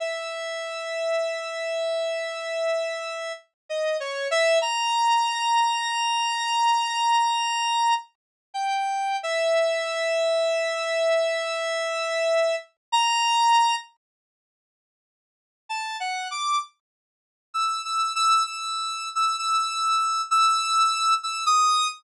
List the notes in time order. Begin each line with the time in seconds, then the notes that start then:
0.00 E5
3.69 D#5
4.00 C#5
4.31 E5
4.62 A#5
8.54 G5
9.23 E5
12.92 A#5
15.69 A5
16.00 F#5
16.31 D6
17.54 E6
17.85 E6
18.15 E6
18.46 E6
19.15 E6
19.38 E6
20.31 E6
21.23 E6
21.46 D#6